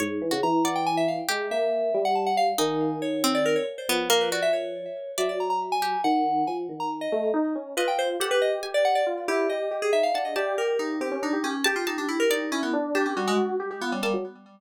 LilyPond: <<
  \new Staff \with { instrumentName = "Electric Piano 2" } { \time 6/8 \tempo 4. = 93 r4 bes''8 ges''16 g''16 aes''16 e''16 f''16 r16 | r8 e''4~ e''16 ges''16 a''16 ges''16 f''16 r16 | aes''4 des''8. d''16 bes'16 des''16 r16 c''16 | r8 bes'16 b'16 d''16 e''16 des''4. |
e''16 d''16 bes''16 bes''16 r16 aes''8. ges''4 | aes''16 r8 bes''16 r16 ees''8. r4 | b'16 g''16 c''16 r16 a'16 b'16 ees''16 r8 d''16 ges''16 d''16 | r8 g'8 ees''8. aes'16 e''16 f''16 ges''16 ees''16 |
d''8 bes'8 ees'8 g'8 ees'8 des'8 | g'16 f'16 ees'16 d'16 e'16 bes'16 ees'8 des'16 b16 r8 | d'16 des'16 g16 aes16 r4 b16 g16 g16 r16 | }
  \new Staff \with { instrumentName = "Electric Piano 1" } { \time 6/8 aes,8 e16 des16 e2 | aes8 bes4 g4. | ees2~ ees8 r8 | f2~ f8 r8 |
ges2 ees4 | f8 ees4 a8 ees'8 des'8 | f'4 g'4 g'4 | f'8 e'8 g'8 g'8 ees'8 d'8 |
g'8 g'4 c'16 des'16 d'16 g'16 g'16 r16 | g'8 g'4. e'8 d'8 | g'8 ges'4 g'16 g'16 f'16 des'16 bes16 ges16 | }
  \new Staff \with { instrumentName = "Harpsichord" } { \time 6/8 des''8. ges'16 r8 d''4. | g'2. | ees'4. c'4 r8 | b8 bes8 ges'8 r4. |
d''4. g'8 r4 | r2. | ees''4 ges''4 aes''8 r8 | r2 r8 a''8 |
a''2. | a''8 a''4 d''4 r8 | a''2~ a''8 a''8 | }
>>